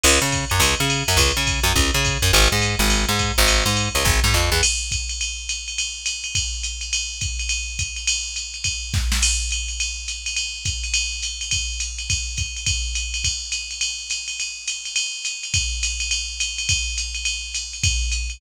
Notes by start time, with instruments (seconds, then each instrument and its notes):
0.03 electric bass (finger) C#2, crash, ride
0.22 electric bass (finger) C#3
0.32 kick, hi-hat pedal, ride
0.50 electric bass (finger) F#2, ride
0.60 electric bass (finger) C#2, ride
0.80 electric bass (finger) C#3
0.90 hi-hat pedal, ride
1.08 electric bass (finger) F#2, ride
1.17 electric bass (finger) C#2, kick, ride
1.37 electric bass (finger) C#3
1.47 kick, hi-hat pedal, ride
1.63 electric bass (finger) F#2, ride
1.76 electric bass (finger) C#2, kick, ride
1.94 electric bass (finger) C#3
2.05 kick, hi-hat pedal, ride
2.22 electric bass (finger) F#2, ride
2.33 electric bass (finger) G#1, ride
2.52 electric bass (finger) G#2
2.62 hi-hat pedal, ride
2.79 electric bass (finger) G#1, ride
2.90 ride
3.09 electric bass (finger) G#2
3.19 kick, hi-hat pedal, ride
3.38 electric bass (finger) G#1, ride
3.48 ride
3.66 electric bass (finger) G#2
3.76 hi-hat pedal, ride
3.95 electric bass (finger) C#2, ride
4.05 electric bass (finger) G#1, kick, snare
4.24 electric bass (finger) G#2, snare
4.34 electric bass (finger) F2, snare
4.52 electric bass (finger) E2
4.63 crash, ride
4.92 kick, hi-hat pedal, ride
5.09 ride
5.21 ride
5.49 hi-hat pedal, ride
5.68 ride
5.78 ride
6.06 hi-hat pedal, ride
6.24 ride
6.35 kick, ride
6.63 hi-hat pedal, ride
6.81 ride
6.93 ride
7.21 kick, hi-hat pedal, ride
7.39 ride
7.49 ride
7.79 kick, hi-hat pedal, ride
7.96 ride
8.07 ride
8.36 hi-hat pedal, ride
8.54 ride
8.64 kick, ride
8.94 kick, snare
9.12 snare
9.22 crash, ride
9.51 hi-hat pedal, ride
9.68 ride
9.80 ride
10.08 hi-hat pedal, ride
10.26 ride
10.36 ride
10.65 kick, hi-hat pedal, ride
10.84 ride
10.94 ride
11.23 hi-hat pedal, ride
11.41 ride
11.51 kick, ride
11.80 hi-hat pedal, ride
11.98 ride
12.10 kick, ride
12.37 kick, hi-hat pedal, ride
12.57 ride
12.66 kick, ride
12.95 hi-hat pedal, ride
13.14 ride
13.24 kick, ride
13.52 hi-hat pedal, ride
13.71 ride
13.81 ride
14.10 hi-hat pedal, ride
14.28 ride
14.40 ride
14.68 hi-hat pedal, ride
14.85 ride
14.96 ride
15.25 hi-hat pedal, ride
15.43 ride
15.54 kick, ride
15.83 hi-hat pedal, ride
16.00 ride
16.11 ride
16.40 hi-hat pedal, ride
16.58 ride
16.69 kick, ride
16.98 hi-hat pedal, ride
17.15 ride
17.25 ride
17.54 hi-hat pedal, ride
17.73 ride
17.83 kick, ride
18.12 hi-hat pedal, ride
18.30 ride